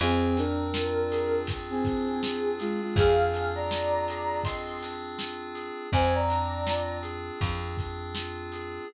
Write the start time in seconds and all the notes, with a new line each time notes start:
0.00 F2 C4 G#4, closed hi-hat
0.37 D4 A#4, closed hi-hat
0.74 F4, snare
1.11 G#4, closed hi-hat
1.47 C4, kick, closed hi-hat
1.70 C4 G#4
1.85 D4, kick, closed hi-hat
2.23 F4, snare
2.59 G#3 F4 G#4, snare, closed hi-hat
2.81 G#3 F4
2.96 F2 C4 G#4 F5, kick, closed hi-hat
3.33 D4, closed hi-hat
3.55 D5 A#5
3.71 F4, snare
4.08 G#4, closed hi-hat
4.44 C4 D#5 C6, kick, closed hi-hat
4.82 D4, closed hi-hat
5.18 F4, snare
5.54 G#4, closed hi-hat
5.92 F2 C4 C5 G#5, kick, closed hi-hat
6.14 D5 A#5
6.29 D4, closed hi-hat
6.66 F4, snare
7.02 G#4, closed hi-hat
7.41 F2 C4, kick, closed hi-hat
7.77 D4, kick, closed hi-hat
8.15 F4, snare
8.52 G#4, closed hi-hat